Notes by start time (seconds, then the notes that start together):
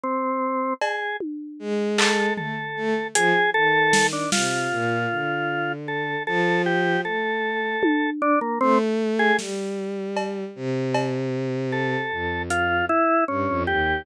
0.04 C4
0.81 G#4, cowbell
1.20 high tom
1.59 G#3
1.98 A4, clap
2.37 A3 A4, floor tom
2.76 A3
3.15 F3 G#4, closed hi-hat
3.54 D#3 A4
3.93 snare
4.13 D4
4.32 C3 F4, snare
4.71 A#2
5.10 D3
5.88 A4
6.27 F3 A4
6.66 G4
7.05 A3 A4
7.83 high tom
8.22 D4
8.41 A#3
8.61 A3 C4
9.19 G#4
9.39 G3, snare
10.17 cowbell
10.56 C3
10.94 cowbell
11.72 A4
12.11 F2
12.50 F4, closed hi-hat
12.89 E4
13.28 G2 C#4
13.48 F2
13.67 D#2 G4